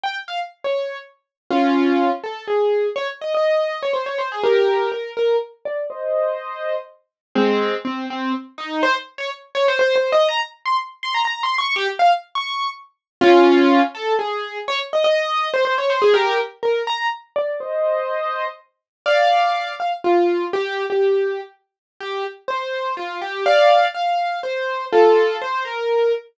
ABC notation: X:1
M:3/4
L:1/16
Q:1/4=123
K:Fm
V:1 name="Acoustic Grand Piano"
g z f z2 d3 z4 | [DF]6 =A2 _A4 | d z e e4 d c d c A | [GB]4 B2 B2 z2 =d2 |
[ce]8 z4 | [A,C]4 C2 C2 z2 E2 | c z2 d z2 d c (3c2 c2 e2 | b z2 c' z2 c' b (3b2 c'2 d'2 |
G z f z2 d'3 z4 | [DF]6 =A2 _A4 | d z e e4 c c d c A | [GB]2 z2 B2 b2 z2 =d2 |
[ce]8 z4 | [K:F] [df]6 f z F4 | G3 G5 z4 | G2 z2 c4 F2 G2 |
[df]4 f4 c4 | [FA]4 c2 B4 z2 |]